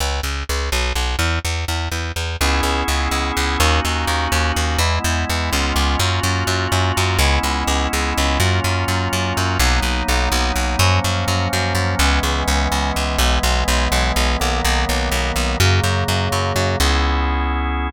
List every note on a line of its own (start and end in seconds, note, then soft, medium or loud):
0.00 0.21 C#2 medium
0.23 0.44 C#2 medium
0.49 0.70 C#2 medium
0.72 0.93 B1 medium
0.96 1.16 B1 medium
1.19 1.39 E2 medium
1.45 1.65 E2 medium
1.68 1.89 E2 medium
1.92 2.12 E2 medium
2.16 2.37 E2 medium
2.41 2.61 C#2 loud
2.41 3.59 B3 medium
2.41 3.59 C#4 loud
2.41 3.59 E4 loud
2.41 3.59 G#4 medium
2.63 2.83 C#2 medium
2.88 3.08 C#2 medium
3.11 3.32 C#2 medium
3.37 3.57 C#2 medium
3.60 3.80 D#2 loud
3.60 4.79 A#3 medium
3.60 4.79 C#4 loud
3.60 4.79 D#4 medium
3.60 4.79 F#4 medium
3.85 4.05 D#2 medium
4.07 4.28 D#2 medium
4.32 4.52 D#2 loud
4.56 4.77 D#2 medium
4.79 4.99 E2 loud
4.79 5.51 G#3 medium
4.79 5.51 B3 loud
4.79 5.51 E4 medium
5.04 5.25 E2 loud
5.29 5.50 E2 medium
5.52 5.73 C#2 loud
5.52 5.99 G#3 loud
5.52 5.99 B3 loud
5.52 5.99 C#4 loud
5.52 5.99 F4 loud
5.76 5.96 C#2 medium
5.99 6.20 F#2 loud
5.99 7.19 A#3 medium
5.99 7.19 C#4 medium
5.99 7.19 F4 medium
5.99 7.19 F#4 medium
6.23 6.44 F#2 medium
6.47 6.67 F#2 medium
6.72 6.92 F#2 medium
6.97 7.18 F#2 loud
7.19 7.39 C#2 loud
7.19 8.39 G#3 medium
7.19 8.39 B3 loud
7.19 8.39 C#4 loud
7.19 8.39 E4 loud
7.43 7.64 C#2 medium
7.67 7.88 C#2 medium
7.93 8.13 C#2 medium
8.18 8.38 C#2 medium
8.40 8.60 F#2 loud
8.40 9.58 F#3 medium
8.40 9.58 A#3 medium
8.40 9.58 C#4 loud
8.40 9.58 F4 loud
8.64 8.85 F#2 medium
8.88 9.08 F#2 medium
9.13 9.33 F#2 medium
9.37 9.58 F#2 medium
9.60 9.80 B1 loud
9.60 10.79 F#3 medium
9.60 10.79 A#3 medium
9.60 10.79 B3 medium
9.60 10.79 D#4 loud
9.83 10.03 B1 medium
10.08 10.29 B1 medium
10.32 10.52 B1 medium
10.56 10.76 B1 medium
10.79 11.00 F#2 loud
10.79 11.99 F3 medium
10.79 11.99 F#3 medium
10.79 11.99 A#3 loud
10.79 11.99 C#4 loud
11.04 11.25 F#2 medium
11.28 11.48 F#2 medium
11.53 11.73 F#2 medium
11.75 11.95 F#2 medium
11.99 12.20 C#2 loud
11.99 13.19 E3 loud
11.99 13.19 G#3 loud
11.99 13.19 B3 loud
11.99 13.19 C#4 medium
12.23 12.44 C#2 medium
12.48 12.68 C#2 medium
12.72 12.92 C#2 medium
12.96 13.17 C#2 medium
13.19 13.39 B1 loud
13.19 14.39 E3 medium
13.19 14.39 G#3 loud
13.19 14.39 B3 loud
13.43 13.64 B1 loud
13.68 13.88 B1 medium
13.92 14.12 B1 loud
14.16 14.37 B1 medium
14.40 14.61 B1 medium
14.40 15.58 D#3 loud
14.40 15.58 F#3 medium
14.40 15.58 A#3 loud
14.40 15.58 B3 medium
14.64 14.85 B1 loud
14.89 15.09 B1 medium
15.12 15.32 B1 medium
15.36 15.56 B1 medium
15.60 15.80 F#2 loud
15.60 16.79 C#3 loud
15.60 16.79 F#3 medium
15.60 16.79 A#3 loud
15.84 16.04 F#2 medium
16.08 16.29 F#2 medium
16.32 16.53 F#2 medium
16.56 16.76 F#2 medium
16.80 17.90 C#2 loud
16.80 17.90 B3 loud
16.80 17.90 C#4 loud
16.80 17.90 E4 loud
16.80 17.90 G#4 medium